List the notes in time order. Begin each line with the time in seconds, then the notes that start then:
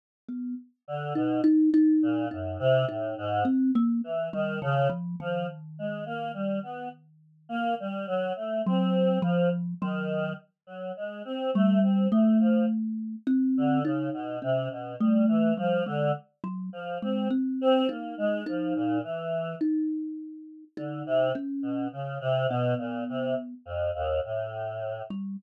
0.29 B3
0.87 D3
1.15 B2 D#4
1.44 D#4
1.74 D#4
2.02 A#2
2.31 F#2 D#4
2.59 C3
2.88 A2 D#4
3.18 G#2
3.45 C4
3.75 A#3
4.03 E3
4.33 D#3 G3
4.62 C#3 D#3
4.89 F3
5.20 D#3 F3
5.78 G#3
6.06 A#3
6.34 G3
6.63 B3
7.49 A#3
7.80 G3
8.07 F#3
8.36 A3
8.66 F#3 C4
9.22 F3
9.81 D#3 F#3
10.66 F#3
10.97 G#3
11.25 C4
11.54 G3 A3
11.82 C4
12.12 A3
12.40 F3
13.27 C4
13.57 D3
13.84 C#3 D#4
14.13 B2
14.42 C3 C#4
14.70 B2
15.00 G3 A3
15.28 E3
15.57 F3 G3
15.86 D3 G#3
16.44 F#3
16.72 F3
17.02 G#3 C4
17.31 C4
17.61 C4
17.89 A#3 D#4
18.18 G#3
18.46 F3 D#4
18.75 A#2
19.03 E3
19.61 D#4
20.77 D3 D#4
21.06 C3
21.35 C#4
21.62 B2
21.92 C#3
22.21 C3
22.49 B2 B3
22.78 A#2
23.09 C3
23.65 F2
23.94 D#2
24.24 A2
25.10 G3